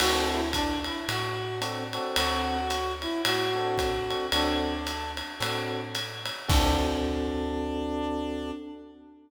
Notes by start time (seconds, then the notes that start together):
0.00 D2 C4 D4 F#4 A4, crash, ride
0.32 E4
0.53 D4, kick, hi-hat pedal, ride
0.84 E4, ride
1.08 A2 F#4, ride
1.61 C4 D4 F#4 A4, hi-hat pedal, ride
1.93 C4 D4 F#4 A4, ride
2.16 D2 F#4, ride
2.70 hi-hat pedal, ride
3.02 E4, ride
3.24 A2 F#4, ride
3.55 C4 D4 F#4 A4
3.78 kick, hi-hat pedal, ride
4.10 C4 D4 F#4 A4, ride
4.32 D2 C4 D4 F#4 A4, ride
4.87 hi-hat pedal, ride
5.17 ride
5.40 A2 C4 D4 F#4 A4, ride
5.95 hi-hat pedal, ride
6.25 ride
6.48 D2 C4 D4 F#4 A4, kick, crash